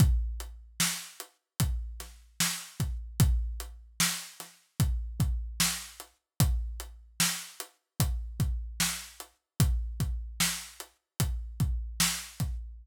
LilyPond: \new DrumStaff \drummode { \time 4/4 \tempo 4 = 75 <hh bd>8 hh8 sn8 hh8 <hh bd>8 <hh sn>8 sn8 <hh bd>8 | <hh bd>8 hh8 sn8 <hh sn>8 <hh bd>8 <hh bd>8 sn8 hh8 | <hh bd>8 hh8 sn8 hh8 <hh bd>8 <hh bd>8 sn8 hh8 | <hh bd>8 <hh bd>8 sn8 hh8 <hh bd>8 <hh bd>8 sn8 <hh bd>8 | }